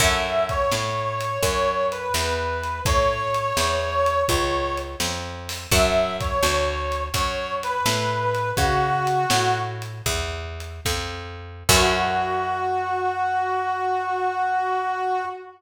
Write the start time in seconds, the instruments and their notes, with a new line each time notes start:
0.00 electric bass (finger) F#2, acoustic guitar (steel) C#4 E4 F#4 A4, brass section E5, kick, closed hi-hat
0.49 brass section C#5, kick, closed hi-hat
0.72 electric bass (finger) A2, snare
1.21 closed hi-hat
1.43 electric bass (finger) F#2, brass section C#5, kick, closed hi-hat
1.92 brass section B4, closed hi-hat
2.14 electric bass (finger) E2, snare
2.63 closed hi-hat
2.85 electric bass (finger) A2, brass section C#5, kick, closed hi-hat
3.34 closed hi-hat
3.57 electric bass (finger) E2, snare
4.06 closed hi-hat
4.29 electric bass (finger) C#2, brass section C#5, kick, closed hi-hat
4.77 closed hi-hat
5.00 electric bass (finger) F2, snare
5.49 open hi-hat
5.71 electric bass (finger) F#2, acoustic guitar (steel) C#5 E5 F#5 A5, brass section E5, kick, closed hi-hat
6.21 brass section C#5, kick, closed hi-hat
6.43 electric bass (finger) D2, snare
6.92 closed hi-hat
7.14 electric bass (finger) F#2, brass section C#5, kick, closed hi-hat
7.63 brass section B4, closed hi-hat
7.86 electric bass (finger) A2, snare
8.35 closed hi-hat
8.56 electric bass (finger) C#3, brass section F#4, kick, closed hi-hat
9.07 closed hi-hat
9.30 electric bass (finger) A2, snare
9.82 closed hi-hat
10.06 electric bass (finger) E2, kick, closed hi-hat
10.60 closed hi-hat
10.85 electric bass (finger) F2, kick, snare
11.69 electric bass (finger) F#2, acoustic guitar (steel) C#4 E4 F#4 A4, brass section F#4, kick, crash